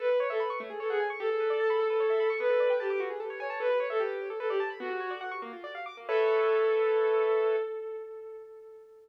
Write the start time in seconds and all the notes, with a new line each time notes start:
0.00 A4 B4
0.10 B4
0.20 C#5
0.30 A4 E5
0.40 B5
0.50 C#6
0.60 A3
0.70 G#4
0.80 A4 C#5
0.89 G#4 F#5
1.00 G#5
1.10 C#6
1.20 G4 A4
1.30 A4
1.40 B4
1.50 D5
1.60 A5
1.70 B5
1.80 A4
1.90 B4
2.00 C#5
2.10 E5
2.20 B5
2.30 C#6
2.40 B3 B4
2.50 A4
2.60 D5
2.70 G5
2.80 G4 A5
2.90 D6
3.00 F#4
3.10 G#4
3.20 A4
3.30 C#5
3.40 C#5 G#5
3.50 A5
3.60 A4 B4
3.70 B4
3.79 C#5
3.90 A4 E5
4.00 G4
4.30 A4
4.39 A4 B4
4.49 G4 D5
4.60 A5
4.70 B5
4.80 B3 F#4
4.90 F#4
5.00 C#5
5.11 D5
5.21 F#5
5.31 C#6
5.42 A#3
5.53 F4
5.64 D5
5.75 F5
5.86 D6
5.97 A#3
6.09 A4 B4 C#5 E5